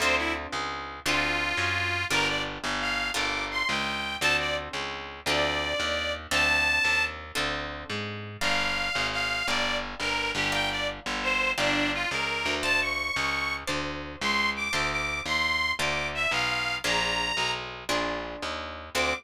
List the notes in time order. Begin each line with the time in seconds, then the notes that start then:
0.00 D2 C4 D4 F4 A4 C5
0.17 E4
0.52 C#2
1.06 D2 C4 D4 F4 A4
1.57 F#2
2.10 G1 D4 F4 G4 A#4
2.28 D5
2.64 G1
2.81 F5
3.14 G1 D4 F4 G4 A#4 D6
3.51 C6
3.68 C#2 G5
4.21 D2 C4 D4 F4 A4 A5
4.39 D5
4.73 C#2
5.26 D2 C4 D4 F4 A4 D5
5.80 D#2
6.31 D2 C4 D4 F4 A4 A5
6.84 D#2
7.35 D2 C4 D4 F4 A4
7.90 G#2
8.41 G1 D5 F5 G5 A#5
8.95 G#1
9.12 F5
9.48 G1 D5 F5 G5 A#5
10.00 G1 A#4
10.35 G1 G4
10.52 D5 F5 G5 A#5
10.70 D5
11.06 G1
11.23 C5
11.58 G1 D4 D5 F5 G5 A#5
11.93 F4
12.11 C#2 A#4
12.45 D2
12.63 C5 D5 F5 A5
12.81 C#6
13.16 C#2
13.67 D2 C5 D5 F5 A5
14.21 C#2 C6
14.56 D6
14.73 D2 C5 D5 F5 A5 D6
14.91 D6
15.26 D#2 C6
15.79 D2 C5 D5 F5 A5 D6
16.14 E5
16.31 B1 F5
16.84 A#1 D4 F4 G#4 A#4 A#5
17.37 B1
17.89 A#1 D4 F4 G#4 A#4
18.42 D#2
18.95 D2 C4 D4 F4 A4 D6